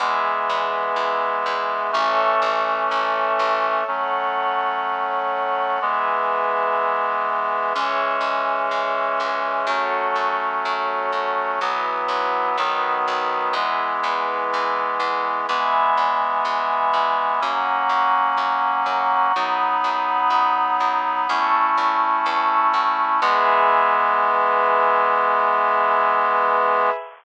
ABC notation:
X:1
M:4/4
L:1/8
Q:1/4=62
K:E
V:1 name="Clarinet"
[E,G,B,]4 [E,A,C]4 | [F,A,C]4 [E,G,B,]4 | [E,G,C]4 [F,A,C]4 | [E,F,B,]2 [D,F,B,]2 [E,G,B,]4 |
[E,G,B,]4 [F,^A,C]4 | [F,B,D]4 [A,CE]4 | [E,G,B,]8 |]
V:2 name="Pad 5 (bowed)"
[GBe]4 [Ace]4 | [Acf]4 [GBe]4 | [Gce]4 [FAc]4 | [EFB]2 [DFB]2 [EGB]4 |
[egb]4 [f^ac']4 | [fbd']4 [ac'e']4 | [GBe]8 |]
V:3 name="Electric Bass (finger)" clef=bass
E,, E,, E,, E,, A,,, A,,, A,,, A,,, | z8 | C,, C,, C,, C,, F,, F,, F,, F,, | B,,, B,,, B,,, B,,, E,, E,, E,, E,, |
E,, E,, E,, E,, F,, F,, F,, F,, | F,, F,, F,, F,, E,, E,, E,, E,, | E,,8 |]